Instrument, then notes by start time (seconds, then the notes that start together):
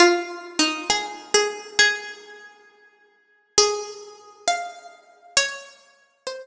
pizzicato strings
0.00 F4
0.59 D#4
0.90 G#4
1.34 G#4
1.79 G#4
3.58 G#4
4.48 F5
5.37 C#5
6.27 C5